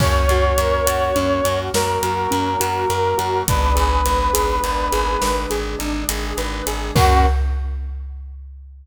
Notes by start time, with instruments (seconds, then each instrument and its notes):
0.00 electric bass (finger) F#2, brass section A#3 C#4 F#4 C#5, acoustic grand piano C#4, kick, crash
0.29 electric bass (finger) F#2, acoustic grand piano F#4, closed hi-hat
0.58 electric bass (finger) F#2, acoustic grand piano A#4, closed hi-hat
0.86 electric bass (finger) F#2, acoustic grand piano F#4, closed hi-hat
1.16 electric bass (finger) F#2, acoustic grand piano C#4, closed hi-hat
1.44 electric bass (finger) F#2, acoustic grand piano F#4, closed hi-hat
1.74 electric bass (finger) F#2, brass section F#3 A#3 F#4 A#4, acoustic grand piano A#4, snare
2.03 electric bass (finger) F#2, acoustic grand piano F#4, closed hi-hat
2.31 electric bass (finger) F#2, acoustic grand piano C#4, closed hi-hat
2.60 electric bass (finger) F#2, acoustic grand piano F#4, closed hi-hat
2.90 electric bass (finger) F#2, acoustic grand piano A#4, closed hi-hat
3.18 electric bass (finger) F#2, acoustic grand piano F#4, closed hi-hat
3.47 electric bass (finger) G#1, brass section G#3 B3 D4 B4, acoustic grand piano D4, kick, closed hi-hat
3.75 electric bass (finger) G#1, acoustic grand piano G#4, closed hi-hat
4.06 electric bass (finger) G#1, acoustic grand piano B4, closed hi-hat
4.33 electric bass (finger) G#1, acoustic grand piano G#4, closed hi-hat
4.64 electric bass (finger) G#1, acoustic grand piano D4, closed hi-hat
4.92 electric bass (finger) G#1, acoustic grand piano G#4, closed hi-hat
5.22 electric bass (finger) G#1, brass section D3 G#3 D4, acoustic grand piano B4, snare
5.50 electric bass (finger) G#1, acoustic grand piano G#4, closed hi-hat
5.79 electric bass (finger) G#1, acoustic grand piano D4, closed hi-hat
6.09 electric bass (finger) G#1, acoustic grand piano G#4, closed hi-hat
6.37 electric bass (finger) G#1, acoustic grand piano B4, closed hi-hat
6.67 electric bass (finger) G#1, acoustic grand piano G#4, closed hi-hat
6.95 electric bass (finger) F#2, brass section A#3 C#4 F#4, acoustic grand piano C#4 F#4 A#4, kick, crash